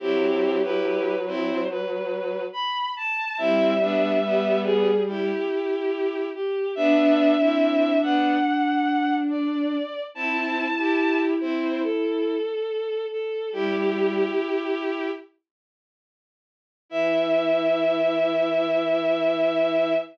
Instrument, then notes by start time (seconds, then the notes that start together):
violin
0.00 F#3 C4 E4 G4
0.63 E4 G4 B4
1.26 C4 E4 C5
1.70 B4
2.53 B5
2.96 A5
3.38 G3 C4 E4 E5
3.81 B3 D4
4.23 G3 B3
4.64 G#4
5.07 E4 G4
6.34 G4
6.75 B3 D4 E5
7.39 C4 E4
8.02 B3 D4 F#5
9.30 D5
10.14 C4 E4 A5
10.77 E4 G4
11.40 C4 E4 C5
11.83 A4
13.11 A4
13.52 G3 E4 G4
16.89 E3 E4 E5